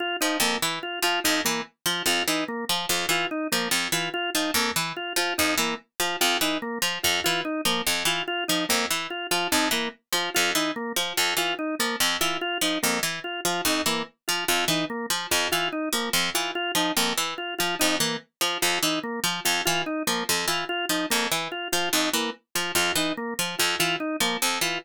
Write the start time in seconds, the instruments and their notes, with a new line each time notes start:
0.00 drawbar organ F4
0.21 harpsichord F3, drawbar organ D#4
0.40 harpsichord F2, drawbar organ A#3
0.62 harpsichord E3
0.83 drawbar organ F4
1.02 harpsichord F3, drawbar organ F4
1.24 harpsichord F2, drawbar organ D#4
1.45 harpsichord E3, drawbar organ A#3
1.86 harpsichord F3, drawbar organ F4
2.06 harpsichord F2, drawbar organ F4
2.28 harpsichord E3, drawbar organ D#4
2.48 drawbar organ A#3
2.69 harpsichord F3
2.89 harpsichord F2, drawbar organ F4
3.09 harpsichord E3, drawbar organ F4
3.31 drawbar organ D#4
3.52 harpsichord F3, drawbar organ A#3
3.71 harpsichord F2
3.92 harpsichord E3, drawbar organ F4
4.14 drawbar organ F4
4.34 harpsichord F3, drawbar organ D#4
4.54 harpsichord F2, drawbar organ A#3
4.76 harpsichord E3
4.97 drawbar organ F4
5.16 harpsichord F3, drawbar organ F4
5.38 harpsichord F2, drawbar organ D#4
5.58 harpsichord E3, drawbar organ A#3
6.00 harpsichord F3, drawbar organ F4
6.21 harpsichord F2, drawbar organ F4
6.41 harpsichord E3, drawbar organ D#4
6.62 drawbar organ A#3
6.82 harpsichord F3
7.03 harpsichord F2, drawbar organ F4
7.24 harpsichord E3, drawbar organ F4
7.45 drawbar organ D#4
7.65 harpsichord F3, drawbar organ A#3
7.87 harpsichord F2
8.05 harpsichord E3, drawbar organ F4
8.28 drawbar organ F4
8.48 harpsichord F3, drawbar organ D#4
8.69 harpsichord F2, drawbar organ A#3
8.91 harpsichord E3
9.10 drawbar organ F4
9.31 harpsichord F3, drawbar organ F4
9.52 harpsichord F2, drawbar organ D#4
9.71 harpsichord E3, drawbar organ A#3
10.13 harpsichord F3, drawbar organ F4
10.34 harpsichord F2, drawbar organ F4
10.55 harpsichord E3, drawbar organ D#4
10.76 drawbar organ A#3
10.96 harpsichord F3
11.17 harpsichord F2, drawbar organ F4
11.37 harpsichord E3, drawbar organ F4
11.59 drawbar organ D#4
11.79 harpsichord F3, drawbar organ A#3
12.00 harpsichord F2
12.21 harpsichord E3, drawbar organ F4
12.41 drawbar organ F4
12.61 harpsichord F3, drawbar organ D#4
12.83 harpsichord F2, drawbar organ A#3
13.03 harpsichord E3
13.24 drawbar organ F4
13.45 harpsichord F3, drawbar organ F4
13.65 harpsichord F2, drawbar organ D#4
13.86 harpsichord E3, drawbar organ A#3
14.28 harpsichord F3, drawbar organ F4
14.48 harpsichord F2, drawbar organ F4
14.68 harpsichord E3, drawbar organ D#4
14.90 drawbar organ A#3
15.10 harpsichord F3
15.31 harpsichord F2, drawbar organ F4
15.52 harpsichord E3, drawbar organ F4
15.72 drawbar organ D#4
15.93 harpsichord F3, drawbar organ A#3
16.13 harpsichord F2
16.34 harpsichord E3, drawbar organ F4
16.55 drawbar organ F4
16.75 harpsichord F3, drawbar organ D#4
16.97 harpsichord F2, drawbar organ A#3
17.17 harpsichord E3
17.38 drawbar organ F4
17.59 harpsichord F3, drawbar organ F4
17.79 harpsichord F2, drawbar organ D#4
18.00 harpsichord E3, drawbar organ A#3
18.41 harpsichord F3, drawbar organ F4
18.62 harpsichord F2, drawbar organ F4
18.83 harpsichord E3, drawbar organ D#4
19.03 drawbar organ A#3
19.24 harpsichord F3
19.45 harpsichord F2, drawbar organ F4
19.65 harpsichord E3, drawbar organ F4
19.86 drawbar organ D#4
20.07 harpsichord F3, drawbar organ A#3
20.29 harpsichord F2
20.48 harpsichord E3, drawbar organ F4
20.69 drawbar organ F4
20.89 harpsichord F3, drawbar organ D#4
21.10 harpsichord F2, drawbar organ A#3
21.32 harpsichord E3
21.52 drawbar organ F4
21.72 harpsichord F3, drawbar organ F4
21.93 harpsichord F2, drawbar organ D#4
22.13 harpsichord E3, drawbar organ A#3
22.55 harpsichord F3, drawbar organ F4
22.75 harpsichord F2, drawbar organ F4
22.96 harpsichord E3, drawbar organ D#4
23.17 drawbar organ A#3
23.39 harpsichord F3
23.59 harpsichord F2, drawbar organ F4
23.79 harpsichord E3, drawbar organ F4
24.00 drawbar organ D#4
24.20 harpsichord F3, drawbar organ A#3
24.42 harpsichord F2
24.61 harpsichord E3, drawbar organ F4